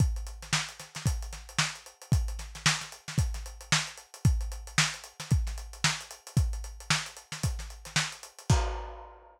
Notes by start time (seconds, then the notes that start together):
0.00 kick, closed hi-hat
0.16 closed hi-hat
0.27 closed hi-hat
0.42 snare, closed hi-hat
0.53 snare
0.69 closed hi-hat
0.80 snare, closed hi-hat
0.95 snare, closed hi-hat
1.06 kick, closed hi-hat
1.22 closed hi-hat
1.33 snare, closed hi-hat
1.49 closed hi-hat
1.59 snare
1.75 closed hi-hat
1.86 closed hi-hat
2.02 closed hi-hat
2.12 kick, closed hi-hat
2.28 closed hi-hat
2.39 snare, closed hi-hat
2.55 snare, closed hi-hat
2.66 snare
2.81 snare, closed hi-hat
2.92 closed hi-hat
3.08 snare, closed hi-hat
3.18 kick, closed hi-hat
3.34 snare, closed hi-hat
3.46 closed hi-hat
3.61 closed hi-hat
3.72 snare
3.87 closed hi-hat
3.97 closed hi-hat
4.14 closed hi-hat
4.25 kick, closed hi-hat
4.41 closed hi-hat
4.52 closed hi-hat
4.67 closed hi-hat
4.78 snare
4.94 closed hi-hat
5.04 closed hi-hat
5.20 snare, closed hi-hat
5.31 kick, closed hi-hat
5.47 snare, closed hi-hat
5.58 closed hi-hat
5.73 closed hi-hat
5.84 snare
6.01 closed hi-hat
6.11 closed hi-hat
6.27 closed hi-hat
6.37 kick, closed hi-hat
6.53 closed hi-hat
6.64 closed hi-hat
6.80 closed hi-hat
6.90 snare
7.06 closed hi-hat
7.17 closed hi-hat
7.32 snare, closed hi-hat
7.43 kick, closed hi-hat
7.59 snare, closed hi-hat
7.70 closed hi-hat
7.85 snare, closed hi-hat
7.96 snare
8.12 closed hi-hat
8.23 closed hi-hat
8.38 closed hi-hat
8.50 kick, crash